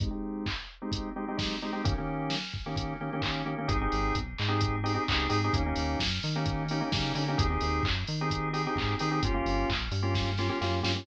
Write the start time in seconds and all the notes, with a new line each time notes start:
0.00 G#3 C4 D#4 G4, kick, closed hi-hat
0.10 G#3 C4 D#4 G4
0.46 kick, clap
0.82 G#3 C4 D#4 G4
0.92 kick, closed hi-hat
1.16 G#3 C4 D#4 G4
1.28 G#3 C4 D#4 G4
1.37 G#3 C4 D#4 G4, kick, snare
1.62 G#3 C4 D#4 G4
1.73 G#3 C4 D#4 G4
1.84 D#3 A#3 C#4 G4, kick, closed hi-hat
1.98 D#3 A#3 C#4 G4
2.30 snare
2.54 kick
2.66 D#3 A#3 C#4 G4
2.76 kick, closed hi-hat
3.01 D#3 A#3 C#4 G4
3.13 D#3 A#3 C#4 G4
3.22 D#3 A#3 C#4 G4, kick, clap
3.46 D#3 A#3 C#4 G4
3.58 D#3 A#3 C#4 G4
3.68 G#1 C4 D#4 G4 G#4, kick, closed hi-hat
3.81 C4 D#4 G4 G#4
3.92 G#1, open hi-hat
4.15 B1, kick, closed hi-hat
4.38 G#2, clap
4.48 C4 D#4 G4 G#4
4.61 kick, closed hi-hat
4.84 C4 D#4 G4 G#4, open hi-hat
4.94 C4 D#4 G4 G#4
5.08 C#2 C4 D#4 G4 G#4, kick, clap
5.29 G#2 C4 D#4 G4 G#4, open hi-hat
5.44 C4 D#4 G4 G#4
5.53 D#2 A#3 C#4 D#4 G4, kick, closed hi-hat
5.66 A#3 C#4 D#4 G4
5.76 D#2, open hi-hat
6.00 F#2, kick, snare
6.23 D#3, open hi-hat
6.36 A#3 C#4 D#4 G4
6.46 kick, closed hi-hat
6.68 A#3 C#4 D#4 G4, open hi-hat
6.81 A#3 C#4 D#4 G4
6.92 C#3 A#3 C#4 D#4 G4, kick, snare
7.15 D3 A#3 C#4 D#4 G4, open hi-hat
7.28 A#3 C#4 D#4 G4
7.38 D#2 C4 D#4 G4 G#4, kick, closed hi-hat
7.50 C4 D#4 G4 G#4
7.61 D#2, open hi-hat
7.83 F#2, kick, clap
8.07 D#3, open hi-hat
8.21 C4 D#4 G4 G#4
8.30 kick, closed hi-hat
8.53 C4 D#4 G4 G#4, open hi-hat
8.67 C4 D#4 G4 G#4
8.76 G#2 C4 D#4 G4 G#4, kick, clap
8.99 D#3 C4 D#4 G4 G#4, open hi-hat
9.11 C4 D#4 G4 G#4
9.22 G1 A#3 C#4 F4 G4, kick, closed hi-hat
9.34 A#3 C#4 F4 G4
9.45 G1, open hi-hat
9.70 A#1, kick, clap
9.91 G2, open hi-hat
10.02 A#3 C#4 F4 G4
10.15 kick, snare
10.38 A#3 C#4 F4 G4, snare
10.49 A#3 C#4 F4 G4
10.61 F#2 A#3 C#4 F4 G4, snare
10.83 G2 A#3 C#4 F4 G4, snare
10.96 A#3 C#4 F4 G4